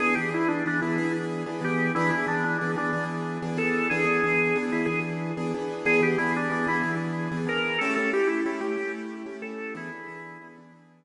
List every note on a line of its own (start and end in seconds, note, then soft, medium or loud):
0.00 0.14 E3 loud
0.00 0.14 B3 loud
0.00 0.14 D4 medium
0.00 0.14 G#4 loud
0.15 0.32 E3 medium
0.15 0.32 B3 medium
0.15 0.32 D4 medium
0.15 0.30 G4 medium
0.15 0.32 G#4 medium
0.32 0.62 E3 medium
0.32 0.62 B3 medium
0.32 0.62 D4 medium
0.32 0.47 E4 loud
0.32 0.62 G#4 medium
0.48 0.64 D4 medium
0.66 0.81 E3 medium
0.66 0.81 B3 medium
0.66 0.81 D4 medium
0.66 0.80 D4 medium
0.66 0.81 G#4 medium
0.81 0.97 E3 medium
0.81 0.97 B3 medium
0.81 0.97 D4 medium
0.81 1.12 E4 medium
0.81 0.97 G#4 medium
0.98 1.43 E3 medium
0.98 1.43 B3 medium
0.98 1.43 D4 medium
0.98 1.43 G#4 medium
1.46 1.61 E3 medium
1.46 1.61 B3 medium
1.46 1.61 D4 medium
1.46 1.61 G#4 medium
1.61 1.91 E3 medium
1.61 1.91 B3 medium
1.61 1.91 D4 medium
1.61 1.92 G4 medium
1.61 1.91 G#4 medium
1.95 2.11 E3 medium
1.95 2.11 B3 loud
1.95 2.11 D4 loud
1.95 2.10 E4 medium
1.95 2.11 G#4 loud
2.11 2.26 E3 medium
2.11 2.26 B3 medium
2.11 2.26 D4 medium
2.11 2.26 E4 medium
2.11 2.26 G#4 medium
2.27 2.57 E3 medium
2.27 2.57 B3 medium
2.27 2.57 D4 medium
2.27 2.43 D4 medium
2.27 2.57 G#4 medium
2.44 2.58 D4 medium
2.58 2.76 E3 medium
2.58 2.76 B3 medium
2.58 2.72 D4 medium
2.58 2.76 D4 medium
2.58 2.76 G#4 medium
2.76 2.91 E3 medium
2.76 2.91 B3 medium
2.76 2.91 D4 medium
2.76 3.04 D4 medium
2.76 2.91 G#4 medium
2.93 3.38 E3 medium
2.93 3.38 B3 medium
2.93 3.38 D4 medium
2.93 3.38 G#4 medium
3.42 3.57 E3 medium
3.42 3.57 B3 medium
3.42 3.57 D4 medium
3.42 3.57 G#4 medium
3.57 3.87 E3 medium
3.57 3.87 B3 medium
3.57 3.87 D4 medium
3.57 3.87 G#4 medium
3.57 3.88 A4 medium
3.90 4.05 E3 loud
3.90 4.05 B3 loud
3.90 4.05 D4 loud
3.90 4.58 G#4 medium
3.90 4.05 G#4 loud
4.05 4.20 E3 medium
4.05 4.20 B3 medium
4.05 4.20 D4 medium
4.05 4.20 G#4 medium
4.24 4.54 E3 medium
4.24 4.54 B3 medium
4.24 4.54 D4 medium
4.24 4.54 G#4 medium
4.55 4.70 E3 medium
4.55 4.70 B3 medium
4.55 4.70 D4 medium
4.55 4.70 G#4 medium
4.72 4.87 E3 medium
4.72 4.87 B3 medium
4.72 4.87 D4 medium
4.72 4.85 E4 medium
4.72 4.87 G#4 medium
4.86 5.32 E3 medium
4.86 5.32 B3 medium
4.86 5.32 D4 medium
4.86 4.99 G#4 medium
4.86 5.32 G#4 medium
5.37 5.52 E3 medium
5.37 5.52 B3 medium
5.37 5.52 D4 medium
5.37 5.52 G#4 medium
5.54 5.84 E3 medium
5.54 5.84 B3 loud
5.54 5.84 D4 medium
5.54 5.84 G#4 medium
5.85 6.00 E3 loud
5.85 6.00 B3 loud
5.85 6.00 D4 loud
5.85 6.00 G#4 medium
5.85 6.01 G#4 loud
6.01 6.16 E3 medium
6.01 6.16 B3 medium
6.01 6.16 D4 medium
6.01 6.18 G4 medium
6.01 6.16 G#4 medium
6.18 6.48 E3 medium
6.18 6.48 B3 medium
6.18 6.48 D4 medium
6.18 6.33 E4 medium
6.18 6.48 G#4 medium
6.36 6.51 D4 medium
6.50 6.65 E3 medium
6.50 6.65 B3 medium
6.50 6.65 D4 medium
6.50 6.68 D4 medium
6.50 6.65 G#4 medium
6.67 6.82 E3 medium
6.67 6.82 B3 loud
6.67 6.82 D4 medium
6.67 6.95 E4 medium
6.67 6.82 G#4 medium
6.83 7.28 E3 medium
6.83 7.28 B3 medium
6.83 7.28 D4 medium
6.83 7.28 G#4 medium
7.32 7.46 E3 medium
7.32 7.46 B3 medium
7.32 7.46 D4 medium
7.32 7.46 G#4 medium
7.47 7.77 E3 medium
7.47 7.77 B3 medium
7.47 7.77 D4 medium
7.47 7.77 G#4 medium
7.47 7.80 A#4 medium
7.78 7.96 A3 loud
7.78 7.96 C#4 loud
7.78 7.96 E4 medium
7.78 7.96 G4 loud
7.78 7.94 A4 loud
7.95 8.12 A3 medium
7.95 8.12 C#4 medium
7.95 8.12 E4 medium
7.95 8.12 G4 medium
7.95 8.11 A4 medium
8.13 8.43 A3 medium
8.13 8.43 C#4 medium
8.13 8.43 E4 medium
8.13 8.43 G4 medium
8.13 8.28 G4 medium
8.27 8.41 E4 medium
8.46 8.60 A3 medium
8.46 8.60 C#4 medium
8.46 8.60 E4 medium
8.46 8.60 G4 medium
8.61 8.76 A3 medium
8.61 8.76 C#4 medium
8.61 8.76 E4 medium
8.61 8.92 G4 medium
8.61 8.76 G4 medium
8.77 9.22 A3 medium
8.77 9.22 C#4 medium
8.77 9.22 E4 medium
8.77 9.22 G4 medium
9.26 9.41 A3 medium
9.26 9.41 C#4 medium
9.26 9.41 E4 medium
9.26 9.41 G4 medium
9.42 9.72 A3 medium
9.42 9.72 C#4 medium
9.42 9.72 E4 medium
9.42 9.72 G4 medium
9.42 9.74 A4 medium
9.75 9.90 E3 loud
9.75 9.90 B3 medium
9.75 9.90 D4 loud
9.75 10.48 E4 loud
9.75 9.90 G#4 loud
9.92 10.07 E3 medium
9.92 10.07 B3 medium
9.92 10.07 D4 medium
9.92 10.07 G#4 medium
10.08 10.38 E3 medium
10.08 10.38 B3 medium
10.08 10.38 D4 medium
10.08 10.38 G#4 loud
10.41 10.56 E3 medium
10.41 10.56 B3 medium
10.41 10.56 D4 medium
10.41 10.56 G#4 medium
10.58 10.72 E3 medium
10.58 10.72 B3 medium
10.58 10.72 D4 medium
10.58 10.72 G#4 medium
10.72 11.04 E3 medium
10.72 11.04 B3 medium
10.72 11.04 D4 medium
10.72 11.04 G#4 medium